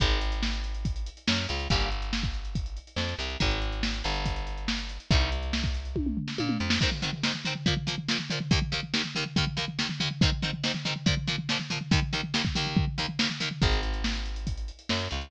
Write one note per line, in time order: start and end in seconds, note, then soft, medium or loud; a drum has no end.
0.00 1.09 G#1 loud
0.00 0.19 D#3 loud
0.00 0.19 G#3 loud
0.00 kick loud
0.00 closed hi-hat loud
0.11 closed hi-hat medium
0.21 closed hi-hat medium
0.32 closed hi-hat medium
0.43 snare loud
0.53 closed hi-hat medium
0.64 closed hi-hat medium
0.74 closed hi-hat medium
0.85 kick medium
0.85 closed hi-hat medium
0.96 closed hi-hat medium
1.06 closed hi-hat medium
1.17 closed hi-hat medium
1.27 1.47 F#2 medium
1.27 1.45 F#3 medium
1.27 snare loud
1.38 closed hi-hat medium
1.49 1.68 C#2 medium
1.49 1.67 C#3 medium
1.49 closed hi-hat medium
1.60 closed hi-hat medium
1.70 2.79 G1 medium
1.70 1.89 C#3 loud
1.70 1.89 G3 loud
1.70 1.89 A#3 loud
1.70 kick medium
1.70 closed hi-hat loud
1.81 closed hi-hat medium
1.91 closed hi-hat medium
2.02 closed hi-hat medium
2.13 snare loud
2.23 kick medium
2.23 closed hi-hat medium
2.34 closed hi-hat medium
2.45 closed hi-hat medium
2.55 kick medium
2.55 closed hi-hat medium
2.66 closed hi-hat medium
2.77 closed hi-hat medium
2.87 closed hi-hat medium
2.96 3.14 F2 medium
2.96 3.16 F3 medium
2.96 snare medium
3.09 closed hi-hat medium
3.19 3.37 C2 medium
3.19 3.38 C3 medium
3.19 closed hi-hat medium
3.30 closed hi-hat medium
3.40 4.02 G#1 medium
3.40 3.59 D#3 medium
3.40 3.59 G#3 loud
3.40 kick medium
3.40 closed hi-hat loud
3.51 closed hi-hat medium
3.62 closed hi-hat medium
3.72 closed hi-hat medium
3.83 snare loud
3.94 closed hi-hat medium
4.04 4.99 G1 medium
4.04 4.98 G2 medium
4.04 closed hi-hat medium
4.15 closed hi-hat medium
4.26 kick medium
4.26 closed hi-hat loud
4.36 closed hi-hat medium
4.47 closed hi-hat medium
4.57 closed hi-hat medium
4.68 snare loud
4.79 closed hi-hat medium
4.89 closed hi-hat medium
5.00 closed hi-hat medium
5.11 6.19 C2 loud
5.11 5.30 C3 medium
5.11 5.30 D#3 loud
5.11 5.30 G3 loud
5.11 kick loud
5.11 closed hi-hat medium
5.21 closed hi-hat medium
5.32 closed hi-hat medium
5.43 closed hi-hat medium
5.53 snare loud
5.64 kick medium
5.64 closed hi-hat medium
5.74 closed hi-hat medium
5.85 closed hi-hat medium
5.96 kick medium
5.96 high tom medium
6.06 mid tom medium
6.17 floor tom medium
6.28 snare medium
6.38 6.58 A#2 medium
6.38 6.56 A#3 medium
6.38 high tom medium
6.49 mid tom medium
6.60 6.79 F2 medium
6.60 6.78 F3 medium
6.70 snare loud
6.81 6.90 G#2 loud
6.81 6.90 D#3 loud
6.81 6.90 C4 loud
6.81 kick medium
6.81 crash medium
6.91 floor tom medium
7.02 7.11 G#2 medium
7.02 7.11 D#3 medium
7.02 7.11 C4 medium
7.02 floor tom medium
7.13 floor tom medium
7.23 7.32 G#2 loud
7.23 7.32 D#3 medium
7.23 7.32 C4 medium
7.23 snare loud
7.34 floor tom medium
7.45 7.54 G#2 loud
7.45 7.54 D#3 medium
7.45 7.54 C4 loud
7.45 floor tom medium
7.55 floor tom medium
7.66 7.74 A#2 loud
7.66 7.74 F3 loud
7.66 7.74 A#3 loud
7.66 kick medium
7.66 floor tom loud
7.77 floor tom medium
7.87 7.95 A#2 medium
7.87 7.95 F3 loud
7.87 7.95 A#3 medium
7.87 floor tom medium
7.98 floor tom medium
8.09 8.18 A#2 loud
8.09 8.18 F3 medium
8.09 8.18 A#3 loud
8.09 snare loud
8.19 floor tom medium
8.30 8.39 A#2 medium
8.30 8.39 F3 loud
8.30 8.39 A#3 medium
8.30 floor tom medium
8.40 floor tom medium
8.51 8.59 D#2 loud
8.51 8.59 D#3 loud
8.51 8.59 A#3 loud
8.51 kick loud
8.51 floor tom medium
8.62 floor tom medium
8.72 8.80 D#2 loud
8.72 8.80 D#3 medium
8.72 8.80 A#3 medium
8.72 floor tom medium
8.83 floor tom medium
8.94 9.02 D#2 loud
8.94 9.02 D#3 loud
8.94 9.02 A#3 medium
8.94 snare loud
9.04 floor tom medium
9.15 9.24 D#2 loud
9.15 9.24 D#3 loud
9.15 9.24 A#3 medium
9.15 floor tom medium
9.26 floor tom medium
9.36 9.45 D#2 loud
9.36 9.45 D#3 loud
9.36 9.45 A#3 loud
9.36 kick medium
9.36 floor tom loud
9.47 floor tom medium
9.57 9.65 D#2 medium
9.57 9.65 D#3 loud
9.57 9.65 A#3 medium
9.57 floor tom medium
9.68 floor tom medium
9.79 9.87 D#2 medium
9.79 9.87 D#3 medium
9.79 9.87 A#3 loud
9.79 snare loud
9.89 floor tom medium
10.00 10.09 D#2 loud
10.00 10.09 D#3 medium
10.00 10.09 A#3 medium
10.00 floor tom medium
10.11 floor tom medium
10.21 10.30 G#2 loud
10.21 10.30 D#3 loud
10.21 10.30 C4 loud
10.21 kick loud
10.21 floor tom medium
10.32 floor tom medium
10.42 10.51 G#2 medium
10.42 10.51 D#3 medium
10.42 10.51 C4 loud
10.42 floor tom medium
10.53 floor tom medium
10.63 10.72 G#2 loud
10.63 10.72 D#3 medium
10.63 10.72 C4 medium
10.63 snare loud
10.74 floor tom medium
10.85 10.94 G#2 medium
10.85 10.94 D#3 loud
10.85 10.94 C4 medium
10.85 floor tom medium
10.96 floor tom medium
11.06 11.15 A#2 loud
11.06 11.15 F3 loud
11.06 11.15 A#3 medium
11.06 kick medium
11.06 floor tom loud
11.17 floor tom medium
11.27 11.36 A#2 loud
11.27 11.36 F3 loud
11.27 11.36 A#3 medium
11.27 floor tom medium
11.38 floor tom medium
11.49 11.58 A#2 medium
11.49 11.58 F3 loud
11.49 11.58 A#3 medium
11.49 snare loud
11.60 floor tom medium
11.70 11.79 A#2 medium
11.70 11.79 F3 medium
11.70 11.79 A#3 loud
11.70 floor tom medium
11.81 floor tom medium
11.91 12.00 D#2 loud
11.91 12.00 D#3 loud
11.91 12.00 A#3 loud
11.91 kick loud
11.91 floor tom loud
12.02 floor tom medium
12.13 12.21 D#2 loud
12.13 12.21 D#3 loud
12.13 12.21 A#3 medium
12.13 floor tom medium
12.23 floor tom medium
12.34 12.42 D#2 loud
12.34 12.42 D#3 medium
12.34 12.42 A#3 medium
12.34 snare loud
12.45 kick medium
12.45 floor tom medium
12.55 12.85 D#2 loud
12.55 12.85 D#3 loud
12.55 12.85 A#3 loud
12.55 floor tom medium
12.66 floor tom medium
12.77 kick loud
12.77 floor tom loud
12.87 floor tom medium
12.98 13.06 D#2 loud
12.98 13.06 D#3 medium
12.98 13.06 A#3 loud
12.98 floor tom medium
13.09 floor tom medium
13.19 13.27 D#2 medium
13.19 13.27 D#3 medium
13.19 13.27 A#3 medium
13.19 snare loud
13.30 floor tom medium
13.40 13.49 D#2 medium
13.40 13.49 D#3 loud
13.40 13.49 A#3 medium
13.40 floor tom medium
13.51 floor tom medium
13.62 14.71 G#1 loud
13.62 13.81 D#3 medium
13.62 13.81 G#3 loud
13.62 kick loud
13.62 closed hi-hat loud
13.72 closed hi-hat medium
13.83 closed hi-hat medium
13.94 closed hi-hat medium
14.04 snare loud
14.15 closed hi-hat medium
14.26 closed hi-hat medium
14.36 closed hi-hat medium
14.47 kick medium
14.47 closed hi-hat loud
14.57 closed hi-hat medium
14.68 closed hi-hat medium
14.79 closed hi-hat medium
14.89 15.08 F#2 medium
14.89 15.08 F#3 medium
14.89 snare loud
15.00 closed hi-hat medium
15.11 15.30 C#2 medium
15.11 15.29 C#3 medium
15.11 closed hi-hat medium
15.21 closed hi-hat medium